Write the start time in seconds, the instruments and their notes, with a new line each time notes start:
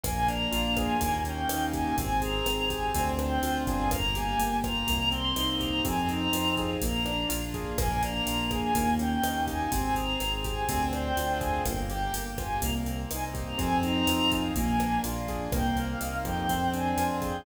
0.04 synth bass 1 A#1, acoustic grand piano A#3, choir aahs G#5, kick, cross-stick, closed hi-hat
0.28 acoustic grand piano D4, choir aahs A#5, closed hi-hat
0.52 synth bass 1 A#1, acoustic grand piano F4, closed hi-hat
0.77 acoustic grand piano G#4, choir aahs G#5, kick, cross-stick, closed hi-hat
1.00 synth bass 1 D#2, acoustic grand piano A#3, kick, closed hi-hat
1.25 acoustic grand piano C#4, choir aahs G5, closed hi-hat
1.49 synth bass 1 D#2, acoustic grand piano D#4, cross-stick, closed hi-hat
1.73 acoustic grand piano G4, choir aahs G#5, kick, closed hi-hat
1.98 synth bass 1 G#1, acoustic grand piano C4, choir aahs G#5, kick, closed hi-hat
2.22 acoustic grand piano G#4, choir aahs A#5, closed hi-hat
2.46 synth bass 1 G#1, acoustic grand piano C4, cross-stick, closed hi-hat
2.69 acoustic grand piano G4, choir aahs G#5, kick, closed hi-hat
2.95 synth bass 1 D2, acoustic grand piano C4, kick, closed hi-hat
3.19 acoustic grand piano D4, choir aahs G5, cross-stick, closed hi-hat
3.42 synth bass 1 D2, acoustic grand piano F4, closed hi-hat
3.67 synth bass 1 G1, acoustic grand piano G#4, choir aahs G#5, kick, closed hi-hat
3.91 acoustic grand piano A#3, choir aahs A#5, kick, cross-stick, closed hi-hat
4.14 acoustic grand piano G4, choir aahs G#5, closed hi-hat
4.39 synth bass 1 G1, acoustic grand piano A#3, closed hi-hat
4.63 acoustic grand piano F4, choir aahs A#5, kick, cross-stick, closed hi-hat
4.87 synth bass 1 C2, acoustic grand piano A#3, kick, closed hi-hat
5.11 acoustic grand piano C4, choir aahs C6, closed hi-hat
5.36 synth bass 1 C2, acoustic grand piano D#4, cross-stick, closed hi-hat
5.60 acoustic grand piano G4, choir aahs A#5, kick, closed hi-hat
5.84 synth bass 1 F2, acoustic grand piano C4, choir aahs G#5, kick, closed hi-hat
6.09 acoustic grand piano D#4, choir aahs A#5, closed hi-hat
6.33 synth bass 1 F2, acoustic grand piano F4, cross-stick, closed hi-hat
6.57 acoustic grand piano G#4, kick, closed hi-hat
6.82 synth bass 1 A#1, acoustic grand piano A#3, choir aahs A#5, kick, closed hi-hat
7.05 acoustic grand piano D4, cross-stick, closed hi-hat
7.29 synth bass 1 A#1, acoustic grand piano F4, closed hi-hat
7.54 acoustic grand piano G#4, kick, closed hi-hat
7.77 synth bass 1 A#1, acoustic grand piano A#3, choir aahs G#5, kick, cross-stick, closed hi-hat
8.02 acoustic grand piano D4, choir aahs A#5, closed hi-hat
8.27 synth bass 1 A#1, acoustic grand piano F4, closed hi-hat
8.51 acoustic grand piano G#4, choir aahs G#5, kick, cross-stick, closed hi-hat
8.74 synth bass 1 D#2, acoustic grand piano A#3, kick, closed hi-hat
8.99 acoustic grand piano C#4, choir aahs G5, closed hi-hat
9.23 synth bass 1 D#2, acoustic grand piano D#4, cross-stick, closed hi-hat
9.47 acoustic grand piano G4, choir aahs G#5, kick, closed hi-hat
9.71 synth bass 1 G#1, acoustic grand piano C4, choir aahs G#5, kick, closed hi-hat
9.95 acoustic grand piano G#4, choir aahs A#5, closed hi-hat
10.20 synth bass 1 G#1, acoustic grand piano C4, cross-stick, closed hi-hat
10.44 acoustic grand piano G4, choir aahs G#5, kick, closed hi-hat
10.69 synth bass 1 D2, acoustic grand piano C4, kick, closed hi-hat
10.93 acoustic grand piano D4, choir aahs G5, cross-stick, closed hi-hat
11.16 synth bass 1 D2, acoustic grand piano F4, closed hi-hat
11.39 acoustic grand piano G#4, choir aahs G#5, kick, closed hi-hat
11.66 synth bass 1 G1, acoustic grand piano A#3, choir aahs G5, kick, cross-stick, closed hi-hat
11.90 acoustic grand piano G4, choir aahs G5, closed hi-hat
12.13 synth bass 1 G1, acoustic grand piano A#3, choir aahs G5, closed hi-hat
12.38 acoustic grand piano F4, choir aahs G#5, kick, cross-stick, closed hi-hat
12.62 synth bass 1 C2, acoustic grand piano A#3, choir aahs A#5, kick, closed hi-hat
12.86 acoustic grand piano C4, closed hi-hat
13.11 synth bass 1 C2, acoustic grand piano D#4, choir aahs G#5, cross-stick, closed hi-hat
13.34 acoustic grand piano G4, kick, closed hi-hat
13.47 choir aahs A#5
13.58 synth bass 1 F2, acoustic grand piano C4, choir aahs G#5, kick, closed hi-hat
13.83 acoustic grand piano D#4, choir aahs A#5, closed hi-hat
14.07 synth bass 1 F2, acoustic grand piano F4, cross-stick, closed hi-hat
14.32 acoustic grand piano G#4, kick, closed hi-hat
14.55 synth bass 1 A#1, acoustic grand piano A#3, choir aahs G#5, kick, closed hi-hat
14.80 acoustic grand piano D4, cross-stick, closed hi-hat
15.04 synth bass 1 A#1, acoustic grand piano F4, closed hi-hat
15.28 acoustic grand piano G#4, kick, closed hi-hat
15.51 synth bass 1 C2, acoustic grand piano A#3, choir aahs G5, kick, cross-stick, closed hi-hat
15.77 acoustic grand piano C4, choir aahs F5, closed hi-hat
16.01 synth bass 1 C2, acoustic grand piano D#4, closed hi-hat
16.24 synth bass 1 F2, acoustic grand piano G4, choir aahs G5, kick, cross-stick, closed hi-hat
16.49 acoustic grand piano C4, kick, closed hi-hat
16.73 acoustic grand piano D4, choir aahs G#5, closed hi-hat
16.97 synth bass 1 F2, acoustic grand piano F4, cross-stick, closed hi-hat
17.22 acoustic grand piano G#4, choir aahs G5, kick, closed hi-hat